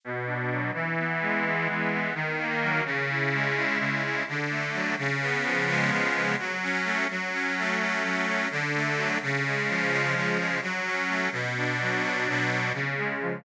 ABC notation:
X:1
M:9/8
L:1/8
Q:3/8=85
K:F#m
V:1 name="Accordion"
B,, D F, | E, B, G, B, E, B, ^D, ^A, F, | C, E G, E C, E D, A, F, | C, B, ^E, G, C, B, F, C A, |
F, C A, C F, C D, A, F, | C, G, ^E, G, C, G, F, C A, | B,, D F, D B,, D C, G, ^E, |]